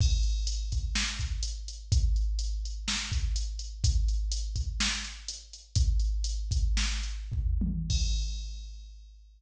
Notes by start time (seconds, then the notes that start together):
0.01 kick, crash
0.23 closed hi-hat
0.47 closed hi-hat
0.72 kick, closed hi-hat
0.95 snare
1.19 kick, closed hi-hat
1.43 closed hi-hat
1.68 closed hi-hat
1.92 kick, closed hi-hat
2.16 closed hi-hat
2.39 closed hi-hat
2.65 closed hi-hat
2.88 snare
3.12 kick, closed hi-hat
3.36 closed hi-hat
3.59 closed hi-hat
3.84 kick, closed hi-hat
4.08 closed hi-hat
4.32 closed hi-hat
4.56 kick, closed hi-hat
4.80 snare
5.04 closed hi-hat
5.28 closed hi-hat
5.53 closed hi-hat
5.75 kick, closed hi-hat
5.99 closed hi-hat
6.24 closed hi-hat
6.51 kick, closed hi-hat
6.77 snare
7.03 closed hi-hat
7.32 kick, floor tom
7.61 high tom
7.90 kick, crash